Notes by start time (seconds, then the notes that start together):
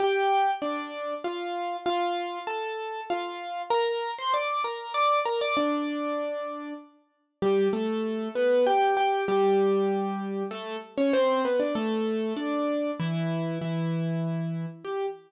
0.00 G4 G5
0.62 D4 D5
1.24 F4 F5
1.86 F4 F5
2.47 A4 A5
3.10 F4 F5
3.70 A#4 A#5
4.18 C5 C6
4.34 D5 D6
4.64 A#4 A#5
4.94 D5 D6
5.25 A#4 A#5
5.41 D5 D6
5.57 D4 D5
7.42 G3 G4
7.73 A3 A4
8.35 B3 B4
8.66 G4 G5
8.97 G4 G5
9.28 G3 G4
10.51 A3 A4
10.98 C#4 C#5
11.13 C4 C5
11.45 B3 B4
11.60 D4 D5
11.75 A3 A4
12.36 D4 D5
13.00 E3 E4
13.61 E3 E4
14.85 G4